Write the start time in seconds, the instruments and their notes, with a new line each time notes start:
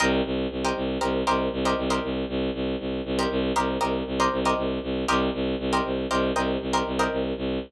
0.00 violin C2, pizzicato strings G4 A#4 C5 D#5
0.25 violin C2
0.51 violin C2
0.65 pizzicato strings G4 A#4 C5 D#5
0.76 violin C2
1.01 violin C2, pizzicato strings G4 A#4 C5 D#5
1.27 violin C2, pizzicato strings G4 A#4 C5 D#5
1.53 violin C2
1.65 pizzicato strings G4 A#4 C5 D#5
1.78 violin C2
1.90 pizzicato strings G4 A#4 C5 D#5
2.03 violin C2
2.29 violin C2
2.54 violin C2
2.80 violin C2
3.05 violin C2
3.19 pizzicato strings G4 A#4 C5 D#5
3.31 violin C2
3.56 violin C2, pizzicato strings G4 A#4 C5 D#5
3.81 violin C2, pizzicato strings G4 A#4 C5 D#5
4.07 violin C2
4.20 pizzicato strings G4 A#4 C5 D#5
4.32 violin C2
4.45 pizzicato strings G4 A#4 C5 D#5
4.57 violin C2
4.83 violin C2
5.08 violin C2, pizzicato strings G4 A#4 C5 D#5
5.34 violin C2
5.59 violin C2
5.73 pizzicato strings G4 A#4 C5 D#5
5.85 violin C2
6.10 violin C2, pizzicato strings G4 A#4 C5 D#5
6.35 violin C2, pizzicato strings G4 A#4 C5 D#5
6.61 violin C2
6.73 pizzicato strings G4 A#4 C5 D#5
6.86 violin C2
6.99 pizzicato strings G4 A#4 C5 D#5
7.12 violin C2
7.37 violin C2